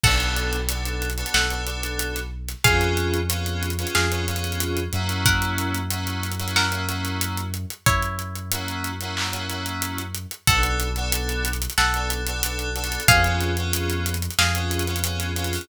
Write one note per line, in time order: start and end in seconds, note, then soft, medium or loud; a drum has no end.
0.04 1.24 B1 medium
0.04 0.58 B3 medium
0.04 0.58 D4 medium
0.04 0.58 F#4 medium
0.04 0.96 A4 medium
0.04 0.58 A4 medium
0.04 0.96 F#5 medium
0.04 kick medium
0.04 crash medium
0.20 closed hi-hat medium
0.37 closed hi-hat medium
0.53 closed hi-hat medium
0.68 1.07 B3 medium
0.68 1.07 D4 medium
0.68 1.07 F#4 medium
0.68 1.07 A4 medium
0.68 closed hi-hat medium
0.85 closed hi-hat medium
1.02 closed hi-hat medium
1.10 closed hi-hat medium
1.18 1.44 B3 medium
1.18 1.44 D4 medium
1.18 1.44 F#4 medium
1.18 1.44 A4 medium
1.18 closed hi-hat medium
1.26 closed hi-hat medium
1.34 2.54 B1 medium
1.34 1.92 A4 soft
1.34 1.92 F#5 medium
1.34 snare loud
1.50 1.63 B3 medium
1.50 1.63 D4 medium
1.50 1.63 F#4 medium
1.50 1.63 A4 medium
1.50 closed hi-hat medium
1.67 2.19 B3 medium
1.67 2.19 D4 medium
1.67 2.19 F#4 medium
1.67 2.19 A4 medium
1.67 closed hi-hat medium
1.83 closed hi-hat medium
1.99 closed hi-hat medium
2.15 snare soft
2.15 closed hi-hat medium
2.48 snare soft
2.48 closed hi-hat medium
2.64 3.85 F2 medium
2.64 3.16 B3 medium
2.64 3.16 C#4 medium
2.64 3.16 F4 loud
2.64 3.16 G#4 medium
2.64 3.54 G#4 medium
2.64 3.54 F5 medium
2.64 kick loud
2.64 closed hi-hat loud
2.81 closed hi-hat medium
2.97 closed hi-hat medium
3.14 closed hi-hat medium
3.29 3.68 B3 medium
3.29 3.68 C#4 medium
3.29 3.68 F4 medium
3.29 3.68 G#4 medium
3.29 closed hi-hat loud
3.46 closed hi-hat medium
3.63 closed hi-hat medium
3.70 closed hi-hat medium
3.79 4.05 B3 medium
3.79 4.05 C#4 medium
3.79 4.05 F4 medium
3.79 4.05 G#4 medium
3.79 closed hi-hat medium
3.87 closed hi-hat medium
3.95 4.88 F2 medium
3.95 4.56 G#4 medium
3.95 4.56 F5 medium
3.95 snare loud
4.11 4.24 B3 medium
4.11 4.24 C#4 medium
4.11 4.24 F4 medium
4.11 4.24 G#4 medium
4.11 closed hi-hat medium
4.27 4.79 B3 medium
4.27 4.79 C#4 medium
4.27 4.79 F4 medium
4.27 4.79 G#4 medium
4.27 closed hi-hat medium
4.36 closed hi-hat medium
4.44 closed hi-hat medium
4.52 closed hi-hat medium
4.60 closed hi-hat medium
4.77 closed hi-hat medium
4.93 7.66 F#2 medium
4.93 5.78 A#3 medium
4.93 5.78 C#4 medium
4.93 5.78 E4 medium
4.93 5.78 F#4 medium
4.93 closed hi-hat medium
5.09 closed hi-hat medium
5.26 6.10 A#4 medium
5.26 6.10 F#5 medium
5.26 kick medium
5.26 closed hi-hat medium
5.42 closed hi-hat medium
5.58 closed hi-hat medium
5.75 closed hi-hat medium
5.90 6.30 A#3 medium
5.90 6.30 C#4 medium
5.90 6.30 E4 medium
5.90 6.30 F#4 medium
5.90 closed hi-hat medium
6.07 closed hi-hat medium
6.23 closed hi-hat medium
6.32 closed hi-hat medium
6.39 6.65 A#3 medium
6.39 6.65 C#4 medium
6.39 6.65 E4 medium
6.39 6.65 F#4 medium
6.39 closed hi-hat medium
6.48 closed hi-hat medium
6.56 7.10 A#4 medium
6.56 7.10 F#5 medium
6.56 snare medium
6.71 6.84 A#3 medium
6.71 6.84 C#4 medium
6.71 6.84 E4 medium
6.71 6.84 F#4 medium
6.71 closed hi-hat medium
6.88 7.40 A#3 medium
6.88 7.40 C#4 medium
6.88 7.40 E4 medium
6.88 7.40 F#4 medium
6.88 snare soft
6.88 closed hi-hat medium
7.05 closed hi-hat medium
7.21 closed hi-hat medium
7.38 closed hi-hat medium
7.54 closed hi-hat medium
7.70 closed hi-hat medium
7.86 10.26 F#2 medium
7.86 8.82 E4 medium
7.86 8.82 C#5 medium
7.86 kick medium
7.86 closed hi-hat medium
8.02 closed hi-hat medium
8.19 closed hi-hat medium
8.35 closed hi-hat medium
8.51 8.90 A#3 medium
8.51 8.90 C#4 medium
8.51 8.90 E4 medium
8.51 8.90 F#4 medium
8.51 closed hi-hat loud
8.68 closed hi-hat medium
8.84 closed hi-hat medium
9.01 9.27 A#3 medium
9.01 9.27 C#4 medium
9.01 9.27 E4 medium
9.01 9.27 F#4 medium
9.01 closed hi-hat medium
9.17 clap loud
9.32 9.45 A#3 medium
9.32 9.45 C#4 medium
9.32 9.45 E4 medium
9.32 9.45 F#4 medium
9.32 closed hi-hat medium
9.48 10.00 A#3 medium
9.48 10.00 C#4 medium
9.48 10.00 E4 medium
9.48 10.00 F#4 medium
9.48 closed hi-hat medium
9.66 closed hi-hat medium
9.82 closed hi-hat medium
9.98 closed hi-hat medium
10.15 closed hi-hat medium
10.31 closed hi-hat medium
10.47 11.67 B1 medium
10.47 10.61 B3 medium
10.47 10.61 D4 loud
10.47 10.61 F#4 medium
10.47 11.40 A4 medium
10.47 10.61 A4 medium
10.47 11.40 F#5 medium
10.47 kick loud
10.47 closed hi-hat loud
10.62 10.88 B3 medium
10.62 10.88 D4 medium
10.62 10.88 F#4 medium
10.62 10.88 A4 medium
10.62 closed hi-hat medium
10.80 closed hi-hat medium
10.96 11.49 B3 medium
10.96 11.49 D4 medium
10.96 11.49 F#4 medium
10.96 11.49 A4 medium
10.96 closed hi-hat medium
11.12 closed hi-hat loud
11.29 closed hi-hat medium
11.45 closed hi-hat medium
11.53 closed hi-hat medium
11.62 closed hi-hat medium
11.70 closed hi-hat medium
11.78 12.98 B1 medium
11.78 12.10 A4 medium
11.78 12.10 F#5 medium
11.78 snare medium
11.94 12.21 B3 medium
11.94 12.21 D4 medium
11.94 12.21 F#4 medium
11.94 12.21 A4 medium
11.94 closed hi-hat medium
12.10 closed hi-hat medium
12.27 12.41 B3 medium
12.27 12.41 D4 medium
12.27 12.41 F#4 medium
12.27 12.41 A4 medium
12.27 closed hi-hat medium
12.43 12.69 B3 medium
12.43 12.69 D4 medium
12.43 12.69 F#4 medium
12.43 12.69 A4 medium
12.43 closed hi-hat loud
12.59 closed hi-hat medium
12.75 13.01 B3 medium
12.75 13.01 D4 medium
12.75 13.01 F#4 medium
12.75 13.01 A4 medium
12.75 closed hi-hat medium
12.84 closed hi-hat medium
12.92 closed hi-hat medium
13.00 closed hi-hat medium
13.08 14.28 F2 medium
13.08 13.21 B3 medium
13.08 13.21 C#4 medium
13.08 13.21 F4 medium
13.08 13.21 G#4 medium
13.08 13.98 G#4 medium
13.08 13.98 F5 loud
13.08 kick loud
13.08 closed hi-hat loud
13.24 13.51 B3 medium
13.24 13.51 C#4 medium
13.24 13.51 F4 medium
13.24 13.51 G#4 medium
13.24 closed hi-hat medium
13.41 closed hi-hat medium
13.57 14.10 B3 medium
13.57 14.10 C#4 medium
13.57 14.10 F4 medium
13.57 14.10 G#4 medium
13.57 closed hi-hat medium
13.73 closed hi-hat loud
13.90 closed hi-hat medium
14.06 closed hi-hat medium
14.14 closed hi-hat medium
14.22 closed hi-hat medium
14.31 closed hi-hat medium
14.39 15.59 F2 medium
14.39 15.00 G#4 medium
14.39 15.00 F5 medium
14.39 snare loud
14.55 14.82 B3 medium
14.55 14.82 C#4 medium
14.55 14.82 F4 medium
14.55 14.82 G#4 medium
14.55 closed hi-hat medium
14.71 closed hi-hat medium
14.79 closed hi-hat medium
14.87 15.00 B3 medium
14.87 15.00 C#4 medium
14.87 15.00 F4 medium
14.87 15.00 G#4 medium
14.87 closed hi-hat medium
14.96 closed hi-hat medium
15.04 15.30 B3 medium
15.04 15.30 C#4 medium
15.04 15.30 F4 medium
15.04 15.30 G#4 medium
15.04 closed hi-hat medium
15.20 snare soft
15.20 closed hi-hat medium
15.35 15.61 B3 medium
15.35 15.61 C#4 medium
15.35 15.61 F4 medium
15.35 15.61 G#4 medium
15.35 closed hi-hat medium
15.44 closed hi-hat medium
15.53 open hi-hat medium
15.61 closed hi-hat medium